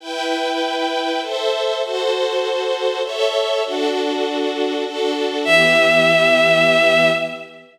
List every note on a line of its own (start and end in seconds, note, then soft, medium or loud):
0.00 1.20 E4 medium
0.00 1.20 B4 medium
0.00 1.20 G5 medium
1.22 1.82 A4 medium
1.22 1.82 C5 medium
1.22 1.82 E5 medium
1.82 3.02 F#4 medium
1.82 3.02 A4 medium
1.82 3.02 C5 loud
3.03 3.63 A4 medium
3.03 3.63 C#5 loud
3.03 3.63 E5 loud
3.64 4.83 D4 loud
3.64 4.83 F#4 loud
3.64 4.83 A4 medium
4.85 5.45 D4 medium
4.85 5.45 F#4 medium
4.85 5.45 A4 medium
5.44 7.10 E3 loud
5.44 7.10 B3 medium
5.44 7.10 G4 loud
5.44 7.09 E5 loud